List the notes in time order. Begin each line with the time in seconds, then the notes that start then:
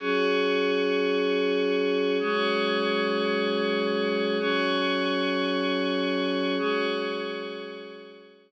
0.00 F#3 C#4 F#4 G#4 C#5
2.20 F#3 G#3 C#4 F#4 G#4 C#5
4.38 F#3 C#4 F#4 G#4 C#5
6.59 F#3 G#3 C#4 F#4 G#4 C#5